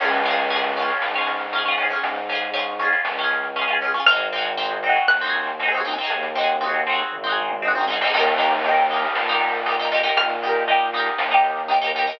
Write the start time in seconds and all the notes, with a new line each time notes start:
0.00 C#2 C#4 F4, kick, crash
0.05 G#4
0.13 closed hi-hat
0.25 C#4 F4, closed hi-hat
0.31 G#4
0.38 closed hi-hat
0.50 C#4 F4, closed hi-hat
0.56 G#4
0.63 closed hi-hat
0.76 C#4 F4, closed hi-hat
0.82 G#4
0.89 closed hi-hat
1.01 G#2, snare
1.14 C#4 F4, closed hi-hat
1.21 G#4
1.27 closed hi-hat
1.40 closed hi-hat
1.53 C#4 F4, closed hi-hat
1.58 G#4
1.65 C#4 F4, closed hi-hat
1.71 G#4
1.78 C#4 F4, closed hi-hat
1.83 G#4
1.90 C#4 F4, closed hi-hat
1.96 G#4
2.03 G#2, kick, closed hi-hat
2.16 closed hi-hat
2.29 C#4 F4, closed hi-hat
2.35 G#4
2.42 closed hi-hat
2.53 C#4 F4, closed hi-hat
2.59 G#4
2.79 C#4 F4, closed hi-hat
2.85 G#4
2.92 closed hi-hat
3.05 C#2, snare
3.18 C#4 F4, closed hi-hat
3.24 G#4
3.31 closed hi-hat
3.43 closed hi-hat
3.56 C#4 F4, closed hi-hat
3.61 G#4
3.68 C#4 F4, closed hi-hat
3.73 G#4
3.81 C#4 F4, closed hi-hat
3.88 G#4
3.94 C#4 F4, closed hi-hat
4.00 G#4
4.06 G#1 C4 F6, kick, closed hi-hat
4.11 D#4 F#4
4.16 G#4, closed hi-hat
4.32 C4 D#4, closed hi-hat
4.38 F#4 G#4
4.45 closed hi-hat
4.57 C4 D#4, closed hi-hat
4.63 F#4 G#4
4.70 closed hi-hat
4.83 C4 D#4, closed hi-hat
4.89 F#4 G#4
4.96 closed hi-hat
5.07 D#2 F#6, snare
5.21 C4 D#4, snare
5.27 F#4 G#4
5.34 closed hi-hat
5.47 closed hi-hat
5.59 C4 D#4, closed hi-hat
5.66 F#4 G#4
5.72 C4 D#4, closed hi-hat
5.77 F#4 G#4
5.85 C4 D#4, closed hi-hat
5.90 F#4 G#4
5.98 C4 D#4, closed hi-hat
6.04 F#4 G#4
6.10 D#2, kick, closed hi-hat
6.23 closed hi-hat
6.35 C4 D#4, closed hi-hat
6.41 F#4 G#4
6.49 closed hi-hat
6.61 C4 D#4, closed hi-hat
6.66 F#4 G#4
6.74 closed hi-hat
6.86 C4 D#4, closed hi-hat
6.92 F#4 G#4
6.99 closed hi-hat
7.12 G#1, kick, floor tom
7.24 C4 D#4, floor tom
7.29 F#4 G#4
7.37 mid tom
7.50 mid tom
7.62 C4 D#4, high tom
7.68 F#4 G#4
7.75 C4 D#4, high tom
7.81 F#4 G#4
7.88 C4 D#4, snare
7.93 F#4 G#4
8.01 C4 D#4, snare
8.07 F#4 G#4
8.14 D#2 D#4 G4, kick, crash
8.19 A#4
8.26 closed hi-hat
8.38 D#4 G4, closed hi-hat
8.43 A#4
8.52 closed hi-hat
8.65 D#4 G4, closed hi-hat
8.71 A#4
8.77 closed hi-hat
8.90 D#4 G4, closed hi-hat
8.96 A#4
9.03 closed hi-hat
9.15 A#2, snare
9.28 D#4, closed hi-hat
9.32 G4 A#4
9.41 closed hi-hat
9.53 closed hi-hat
9.66 D#4 G4, closed hi-hat
9.71 A#4
9.79 D#4 G4, closed hi-hat
9.85 A#4
9.91 D#4 G4, closed hi-hat
9.97 A#4
10.03 D#4 G4, closed hi-hat
10.09 A#4
10.17 A#2 F6, kick, closed hi-hat
10.30 closed hi-hat
10.42 D#4 G4, closed hi-hat
10.49 A#4
10.55 closed hi-hat
10.68 D#4 G4, closed hi-hat
10.73 A#4
10.93 D#4 G4, closed hi-hat
11.00 A#4
11.06 closed hi-hat
11.18 D#2, snare
11.31 D#4 G4, closed hi-hat
11.37 A#4
11.44 closed hi-hat
11.57 closed hi-hat
11.68 D#4 G4, closed hi-hat
11.74 A#4
11.81 D#4 G4, closed hi-hat
11.87 A#4
11.95 D#4 G4, closed hi-hat
12.01 A#4
12.07 D#4 G4, closed hi-hat
12.13 A#4